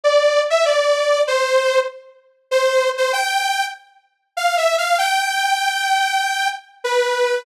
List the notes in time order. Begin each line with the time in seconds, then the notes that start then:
0.04 D5
0.50 E5
0.65 D5
1.27 C5
2.51 C5
2.97 C5
3.13 G5
4.36 F5
4.57 E5
4.78 F5
4.98 G5
6.84 B4